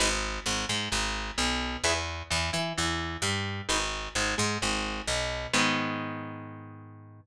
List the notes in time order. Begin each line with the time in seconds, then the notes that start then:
0.00 G#1 D#4 G#4 B4
0.46 G#1 G#2
0.69 G#2 G#3
0.92 G#1 G#2
1.38 B1 B2
1.84 E2 E4 G#4 B4
2.30 E2 E3
2.53 E3 E4
2.77 E2 E3
3.22 G2 G3
3.69 G#1 D#4 G#4 B4
4.15 G#1 G#2
4.38 G#2 G#3
4.62 G#1 G#2
5.07 B1 B2
5.53 G#2 D#3 G#3 B3